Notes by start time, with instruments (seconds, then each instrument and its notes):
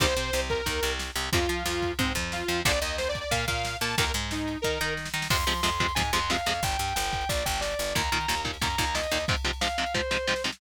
0.00 electric bass (finger) C2, overdriven guitar C3 D#3 G3, lead 2 (sawtooth) C5, kick, ride
0.17 electric bass (finger) C3, overdriven guitar C4, ride
0.33 electric bass (finger) C2, overdriven guitar C3, snare
0.49 lead 2 (sawtooth) A#4, kick, ride
0.66 electric bass (finger) D#2, overdriven guitar D#3, kick, ride
0.83 electric bass (finger) C2, overdriven guitar C3, ride
0.99 snare
1.15 electric bass (finger) C2, overdriven guitar C3, ride
1.33 electric bass (finger) F2, overdriven guitar C3 F3, lead 2 (sawtooth) F4, kick, ride
1.49 electric bass (finger) F3, overdriven guitar F4, ride
1.66 electric bass (finger) F2, overdriven guitar F3, snare
1.82 kick, ride
1.99 electric bass (finger) G#2, overdriven guitar G#3, lead 2 (sawtooth) C4, kick, ride
2.15 electric bass (finger) F2, overdriven guitar F3, kick, ride
2.32 lead 2 (sawtooth) F4, snare
2.48 electric bass (finger) F2, overdriven guitar F3, ride
2.65 electric bass (finger) A#1, overdriven guitar A#2 D3 F3, lead 2 (sawtooth) D5, kick, ride
2.81 electric bass (finger) D#2, overdriven guitar D#3, lead 2 (sawtooth) D#5, ride
2.98 lead 2 (sawtooth) C5, snare
3.09 lead 2 (sawtooth) D5
3.15 kick, ride
3.20 lead 2 (sawtooth) D5
3.31 electric bass (finger) A#2, overdriven guitar A#3, lead 2 (sawtooth) F5, kick, ride
3.47 electric bass (finger) A#2, overdriven guitar A#3, lead 2 (sawtooth) F5, kick, ride
3.65 snare
3.81 electric bass (finger) A#2, overdriven guitar A#3, lead 2 (sawtooth) A5, ride
3.98 electric bass (finger) D#2, overdriven guitar A#2 D#3, lead 2 (sawtooth) A#4, kick, ride
4.14 electric bass (finger) G#2, overdriven guitar G#3, ride
4.31 lead 2 (sawtooth) D#4, snare
4.48 ride
4.62 electric bass (finger) D#3, overdriven guitar D#4, lead 2 (sawtooth) A#4, kick, snare
4.81 electric bass (finger) D#3, overdriven guitar D#4, snare
4.97 snare
5.05 snare
5.14 electric bass (finger) D#3, overdriven guitar D#4, snare
5.22 snare
5.30 electric bass (finger) F2, overdriven guitar C3 F3 G#3, distortion guitar C6, kick, crash
5.39 ride
5.47 overdriven guitar C3 F3 G#3, electric bass (finger) F3, ride
5.55 ride
5.63 electric bass (finger) F2, overdriven guitar C3 F3 G#3, distortion guitar C6, snare
5.72 ride
5.80 overdriven guitar C3 F3 G#3, kick, ride
5.88 ride
5.95 electric bass (finger) G#2, overdriven guitar C3 F3 G#3, distortion guitar G#5, kick, ride
6.05 ride
6.13 electric bass (finger) F2, overdriven guitar C3 F3 G#3, distortion guitar C6, ride
6.22 ride
6.30 overdriven guitar C3 F3 G#3, distortion guitar F5, snare
6.38 ride
6.46 electric bass (finger) F2, overdriven guitar C3 F3 G#3, ride
6.55 ride
6.63 electric bass (finger) G1, distortion guitar G5, kick, ride
6.71 ride
6.79 electric bass (finger) G2, ride
6.88 ride
6.96 electric bass (finger) G1, distortion guitar G5, snare
7.04 ride
7.13 kick, ride
7.21 ride
7.29 electric bass (finger) A#1, distortion guitar D5, kick, ride
7.38 ride
7.46 electric bass (finger) G1, distortion guitar G5, kick, ride
7.54 ride
7.61 distortion guitar D5, snare
7.71 ride
7.79 electric bass (finger) G1, ride
7.87 ride
7.95 electric bass (finger) D#2, overdriven guitar A#2 D#3, distortion guitar A#5, kick, ride
8.04 ride
8.12 overdriven guitar A#2 D#3, electric bass (finger) D#3, ride
8.20 ride
8.28 electric bass (finger) D#2, overdriven guitar A#2 D#3, snare
8.37 ride
8.45 overdriven guitar A#2 D#3, kick, ride
8.54 ride
8.61 electric bass (finger) F#2, overdriven guitar A#2 D#3, distortion guitar A#5, kick, ride
8.70 ride
8.78 electric bass (finger) D#2, overdriven guitar A#2 D#3, kick, ride
8.87 ride
8.95 overdriven guitar A#2 D#3, distortion guitar D#5, snare
9.03 ride
9.11 electric bass (finger) D#2, overdriven guitar A#2 D#3, ride
9.20 ride
9.28 overdriven guitar G#2 C3 F3, kick, ride
9.36 ride
9.45 overdriven guitar G#2 C3 F3, ride
9.53 ride
9.61 overdriven guitar G#2 C3 F3, distortion guitar F5, snare
9.70 ride
9.78 overdriven guitar G#2 C3 F3, ride
9.86 ride
9.94 overdriven guitar G#2 C3 F3, distortion guitar C5, kick, snare
10.11 overdriven guitar G#2 C3 F3, snare
10.27 overdriven guitar G#2 C3 F3, snare
10.36 snare
10.44 overdriven guitar G#2 C3 F3, snare
10.52 snare